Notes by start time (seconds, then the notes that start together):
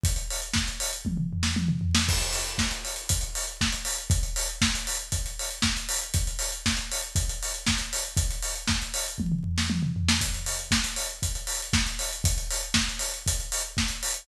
0.04 kick, closed hi-hat
0.16 closed hi-hat
0.31 open hi-hat
0.42 closed hi-hat
0.54 kick, snare
0.68 closed hi-hat
0.80 open hi-hat
0.93 closed hi-hat
1.05 kick, high tom
1.17 mid tom
1.33 floor tom
1.43 snare
1.56 high tom
1.68 mid tom
1.81 floor tom
1.95 snare
2.09 kick, crash
2.20 closed hi-hat
2.33 open hi-hat
2.44 closed hi-hat
2.58 kick, snare
2.71 closed hi-hat
2.85 open hi-hat
2.96 closed hi-hat
3.09 kick, closed hi-hat
3.21 closed hi-hat
3.35 open hi-hat
3.47 closed hi-hat
3.61 kick, snare
3.72 closed hi-hat
3.85 open hi-hat
3.98 closed hi-hat
4.10 kick, closed hi-hat
4.23 closed hi-hat
4.36 open hi-hat
4.49 closed hi-hat
4.62 kick, snare
4.75 closed hi-hat
4.87 open hi-hat
4.99 closed hi-hat
5.12 kick, closed hi-hat
5.26 closed hi-hat
5.39 open hi-hat
5.51 closed hi-hat
5.62 kick, snare
5.77 closed hi-hat
5.89 open hi-hat
6.01 closed hi-hat
6.14 kick, closed hi-hat
6.27 closed hi-hat
6.39 open hi-hat
6.52 closed hi-hat
6.66 kick, snare
6.77 closed hi-hat
6.92 open hi-hat
7.03 closed hi-hat
7.16 kick, closed hi-hat
7.29 closed hi-hat
7.43 open hi-hat
7.54 closed hi-hat
7.67 kick, snare
7.78 closed hi-hat
7.93 open hi-hat
8.05 closed hi-hat
8.17 kick, closed hi-hat
8.31 closed hi-hat
8.42 open hi-hat
8.56 closed hi-hat
8.67 kick, snare
8.82 closed hi-hat
8.94 open hi-hat
9.08 closed hi-hat
9.18 kick, high tom
9.32 mid tom
9.44 floor tom
9.58 snare
9.70 high tom
9.83 mid tom
9.96 floor tom
10.09 snare
10.21 kick, closed hi-hat
10.34 closed hi-hat
10.46 open hi-hat
10.59 closed hi-hat
10.71 kick, snare
10.84 closed hi-hat
10.96 open hi-hat
11.09 closed hi-hat
11.23 kick, closed hi-hat
11.35 closed hi-hat
11.47 open hi-hat
11.62 closed hi-hat
11.73 kick, snare
11.87 closed hi-hat
11.99 open hi-hat
12.13 closed hi-hat
12.24 kick, closed hi-hat
12.38 closed hi-hat
12.51 open hi-hat
12.63 closed hi-hat
12.74 kick, snare
12.89 closed hi-hat
12.99 open hi-hat
13.14 closed hi-hat
13.26 kick, closed hi-hat
13.40 closed hi-hat
13.52 open hi-hat
13.64 closed hi-hat
13.77 kick, snare
13.88 closed hi-hat
14.03 open hi-hat
14.14 closed hi-hat